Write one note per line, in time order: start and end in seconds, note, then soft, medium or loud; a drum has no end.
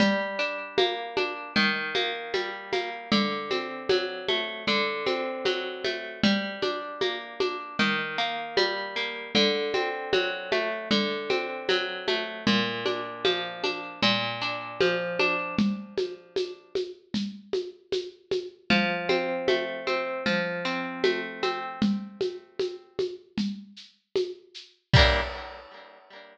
0.00 1.48 G3 medium
0.00 low conga loud
0.00 shaker medium
0.39 1.16 D4 medium
0.39 shaker medium
0.78 1.52 A#3 medium
0.78 high conga loud
0.78 shaker medium
1.17 1.54 D4 medium
1.17 high conga medium
1.17 shaker medium
1.56 3.04 D#3 loud
1.56 low conga medium
1.56 shaker medium
1.95 2.72 A#3 medium
1.95 high conga medium
1.95 shaker medium
2.34 3.08 G3 medium
2.34 high conga medium
2.34 shaker medium
2.73 3.10 A#3 medium
2.73 high conga medium
2.73 shaker medium
3.12 4.60 D3 medium
3.12 low conga loud
3.12 shaker medium
3.51 4.62 C4 medium
3.51 high conga medium
3.51 shaker medium
3.89 4.64 F#3 medium
3.89 high conga loud
3.89 shaker medium
4.28 4.66 A3 medium
4.28 high conga medium
4.28 shaker medium
4.67 6.16 D3 medium
4.67 low conga medium
4.67 shaker medium
5.06 6.18 C4 medium
5.06 high conga medium
5.06 shaker medium
5.45 6.19 F#3 medium
5.45 high conga medium
5.45 shaker medium
5.84 6.21 A3 medium
5.84 high conga medium
5.84 shaker medium
6.23 7.71 G3 medium
6.23 low conga loud
6.23 shaker medium
6.62 7.40 D4 medium
6.62 high conga medium
6.62 shaker medium
7.01 7.75 A#3 medium
7.01 high conga medium
7.01 shaker medium
7.40 7.77 D4 medium
7.40 high conga medium
7.40 shaker medium
7.79 9.27 D#3 loud
7.79 low conga medium
7.79 shaker medium
8.18 8.96 A#3 medium
8.18 shaker medium
8.57 9.31 G3 medium
8.57 high conga medium
8.57 shaker medium
8.96 9.33 A#3 medium
8.96 shaker medium
9.35 10.83 D3 loud
9.35 low conga medium
9.35 shaker medium
9.74 10.85 C4 medium
9.74 high conga medium
9.74 shaker medium
10.13 10.87 F#3 medium
10.13 high conga medium
10.13 shaker medium
10.52 10.89 A3 medium
10.52 high conga medium
10.52 shaker medium
10.91 12.39 D3 medium
10.91 low conga medium
10.91 shaker medium
11.30 12.41 C4 medium
11.30 high conga medium
11.30 shaker medium
11.69 12.43 F#3 medium
11.69 high conga medium
11.69 shaker loud
12.08 12.45 A3 medium
12.08 high conga medium
12.08 shaker medium
12.47 13.95 A#2 medium
12.47 low conga loud
12.47 shaker medium
12.86 13.63 D4 medium
12.86 high conga medium
12.86 shaker medium
13.25 13.99 F3 medium
13.25 high conga medium
13.25 shaker medium
13.64 14.01 D4 medium
13.64 high conga medium
13.64 shaker medium
14.02 15.51 A#2 loud
14.02 low conga medium
14.02 shaker medium
14.41 15.19 D4 medium
14.41 shaker medium
14.81 15.55 F3 medium
14.81 high conga loud
14.81 shaker medium
15.19 15.56 D4 medium
15.19 high conga medium
15.19 shaker medium
15.58 low conga loud
15.58 shaker medium
15.98 high conga medium
15.98 shaker medium
16.36 high conga medium
16.36 shaker medium
16.75 high conga medium
16.75 shaker medium
17.14 low conga medium
17.14 shaker loud
17.53 high conga medium
17.53 shaker medium
17.92 high conga medium
17.92 shaker loud
18.31 high conga medium
18.31 shaker medium
18.70 20.18 F3 medium
18.70 low conga loud
18.70 shaker medium
19.09 19.87 C4 medium
19.09 high conga medium
19.09 shaker medium
19.48 20.22 A3 medium
19.48 high conga loud
19.48 shaker medium
19.87 20.24 C4 medium
19.87 high conga medium
19.87 shaker medium
20.26 21.74 F3 medium
20.26 low conga medium
20.26 shaker medium
20.65 21.42 C4 medium
20.65 shaker medium
21.04 21.78 A3 medium
21.04 high conga loud
21.04 shaker medium
21.43 21.80 C4 medium
21.43 high conga medium
21.43 shaker medium
21.82 low conga loud
21.82 shaker medium
22.21 high conga medium
22.21 shaker medium
22.59 high conga medium
22.59 shaker medium
22.99 high conga medium
22.99 shaker medium
23.38 low conga medium
23.38 shaker medium
23.76 shaker medium
24.16 high conga medium
24.16 shaker medium
24.54 shaker medium
24.94 25.21 G3 loud
24.94 25.21 A#3 loud
24.94 kick loud
24.94 crash loud
24.99 25.21 D4 medium